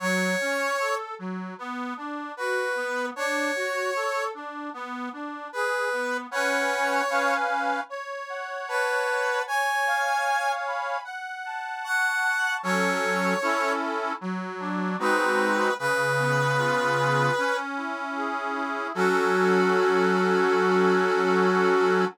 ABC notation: X:1
M:4/4
L:1/8
Q:1/4=76
K:F#m
V:1 name="Brass Section"
c3 z3 B2 | c3 z3 B2 | c3 z3 B2 | g3 z3 f2 |
c3 z3 B2 | B5 z3 | F8 |]
V:2 name="Accordion"
F, C A F, B, D F B, | D F A D B, D G B, | [CBfg]2 [CB^eg]2 c f a f | c ^e g b f a c' a |
[F,CA]2 [CEA]2 F, D [G,^B,^DF]2 | C, B, ^E G C =E G E | [F,CA]8 |]